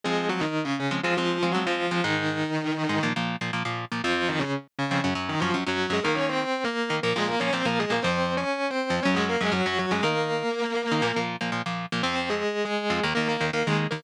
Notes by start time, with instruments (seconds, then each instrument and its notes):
0.04 overdriven guitar F3 G#3 C4, distortion guitar G#3 G#4
0.29 distortion guitar F#3 F#4
0.40 distortion guitar D#3 D#4
0.64 distortion guitar C#3 C#4
0.79 distortion guitar C#3 C#4
0.91 overdriven guitar F3 G#3 C4
1.03 distortion guitar F3 F4, overdriven guitar F3 G#3 C4
1.17 distortion guitar F3 F4, overdriven guitar F3 G#3 C4
1.43 overdriven guitar F3 G#3 C4
1.52 overdriven guitar F3 G#3 C4, distortion guitar F#3 F#4
1.66 distortion guitar F3 F4, overdriven guitar F3 G#3 C4
1.91 overdriven guitar F3 G#3 C4
2.04 overdriven guitar G#2 G#3 D#4, distortion guitar D#3 D#4
2.89 overdriven guitar G#2 G#3 D#4
3.03 overdriven guitar A#2 F3 A#3
3.16 overdriven guitar A#2 F3 A#3
3.41 overdriven guitar A#2 F3 A#3
3.53 overdriven guitar A#2 F3 A#3
3.65 overdriven guitar A#2 F3 A#3
3.92 overdriven guitar A#2 F3 A#3
4.04 overdriven guitar F2 F3 C4, distortion guitar F3 F4
4.28 distortion guitar D#3 D#4
4.39 distortion guitar C#3 C#4
4.79 distortion guitar C#3 C#4
4.91 overdriven guitar F2 F3 C4
5.04 overdriven guitar F#2 F#3 C#4
5.15 overdriven guitar F#2 F#3 C#4
5.29 distortion guitar D#3 D#4
5.40 overdriven guitar F#2 F#3 C#4, distortion guitar F3 F4
5.54 overdriven guitar F#2 F#3 C#4
5.67 overdriven guitar F#2 F#3 C#4, distortion guitar F#3 F#4
5.90 overdriven guitar F#2 F#3 C#4, distortion guitar G#3 G#4
6.03 overdriven guitar D#3 A#3 D#4, distortion guitar A#3 A#4
6.15 distortion guitar C#4 C#5
6.29 distortion guitar C4 C5
6.64 distortion guitar A#3 A#4
6.90 overdriven guitar D#3 A#3 D#4
7.03 overdriven guitar A#2 F3 A#3, distortion guitar A#3 A#4
7.16 overdriven guitar A#2 F3 A#3, distortion guitar G#3 G#4
7.28 distortion guitar A#3 A#4
7.39 overdriven guitar A#2 F3 A#3, distortion guitar C#4 C#5
7.53 overdriven guitar A#2 F3 A#3, distortion guitar C4 C5
7.65 overdriven guitar A#2 F3 A#3, distortion guitar A#3 A#4
7.79 distortion guitar G#3 G#4
7.90 overdriven guitar A#2 F3 A#3, distortion guitar A#3 A#4
8.02 overdriven guitar F2 F3 C4, distortion guitar C4 C5
8.37 distortion guitar C#4 C#5
8.70 distortion guitar C4 C5
8.90 overdriven guitar F2 F3 C4
9.03 overdriven guitar F#2 F#3 C#4, distortion guitar C#4 C#5
9.14 overdriven guitar F#2 F#3 C#4, distortion guitar G#3 G#4
9.29 distortion guitar A#3 A#4
9.41 overdriven guitar F#2 F#3 C#4, distortion guitar G#3 G#4
9.52 overdriven guitar F#2 F#3 C#4, distortion guitar F#3 F#4
9.66 overdriven guitar F#2 F#3 C#4, distortion guitar F#3 F#4
9.78 distortion guitar F#3 F#4
9.91 overdriven guitar F#2 F#3 C#4, distortion guitar G#3 G#4
10.03 overdriven guitar D#3 A#3 D#4, distortion guitar A#3 A#4
10.92 overdriven guitar D#3 A#3 D#4
11.02 overdriven guitar A#2 F3 A#3
11.16 overdriven guitar A#2 F3 A#3
11.41 overdriven guitar A#2 F3 A#3
11.52 overdriven guitar A#2 F3 A#3
11.66 overdriven guitar A#2 F3 A#3
11.92 overdriven guitar A#2 F3 A#3
12.03 overdriven guitar F2 F3 C4, distortion guitar C4 C5
12.15 distortion guitar C4 C5
12.29 distortion guitar G#3 G#4
12.65 distortion guitar G#3 G#4
12.90 overdriven guitar F2 F3 C4
13.03 overdriven guitar D#2 D#3 A#3
13.15 overdriven guitar D#2 D#3 A#3, distortion guitar A#3 A#4
13.28 distortion guitar A#3 A#4
13.41 overdriven guitar D#2 D#3 A#3
13.53 overdriven guitar D#2 D#3 A#3, distortion guitar A#3 A#4
13.67 overdriven guitar D#2 D#3 A#3, distortion guitar G#3 G#4
13.91 overdriven guitar D#2 D#3 A#3, distortion guitar A#3 A#4